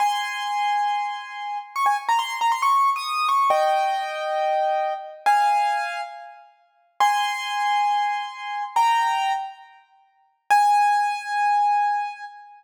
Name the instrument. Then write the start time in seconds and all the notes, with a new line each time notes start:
acoustic grand piano
0.00 G#5 C6
1.76 C#6
1.86 G#5
2.09 A#5
2.19 C6
2.41 A#5
2.52 C6
2.62 C#6
2.96 D#6
3.29 C#6
3.50 D#5 G5
5.26 F5 G#5
7.00 G#5 C6
8.76 G5 A#5
10.50 G#5